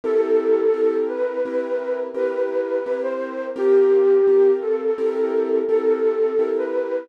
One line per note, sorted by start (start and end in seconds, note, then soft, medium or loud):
0.04 0.67 C4 medium
0.04 0.67 E4 loud
0.04 0.67 G4 loud
0.04 0.97 A4 loud
0.04 0.67 A#4 medium
0.74 1.37 C4 medium
0.74 1.37 E4 medium
0.74 1.37 G4 medium
0.74 1.37 A#4 medium
1.08 1.99 B4 loud
1.45 2.09 C4 medium
1.45 2.09 E4 medium
1.45 2.09 G4 medium
1.45 2.09 A#4 medium
2.14 2.78 C4 medium
2.14 2.78 E4 medium
2.14 2.78 G4 medium
2.14 2.78 A#4 medium
2.14 2.98 B4 loud
2.86 3.50 C4 medium
2.86 3.50 E4 medium
2.86 3.50 G4 medium
2.86 3.50 A#4 medium
3.03 3.46 C5 loud
3.56 4.19 C4 medium
3.56 4.19 F4 medium
3.56 4.19 G4 loud
3.56 4.51 G4 loud
3.56 4.19 A#4 medium
4.27 4.91 C4 medium
4.27 4.91 F4 medium
4.27 4.91 G4 medium
4.27 4.91 A#4 medium
4.61 5.58 A4 loud
4.98 5.62 C4 medium
4.98 5.62 E4 medium
4.98 5.62 G4 medium
4.98 5.62 A#4 loud
5.68 6.32 C4 medium
5.68 6.32 E4 medium
5.68 6.32 G4 medium
5.68 6.50 A4 loud
5.68 6.32 A#4 medium
6.39 7.02 C4 medium
6.39 7.02 E4 medium
6.39 7.02 G4 medium
6.39 7.02 A#4 medium
6.58 7.06 B4 loud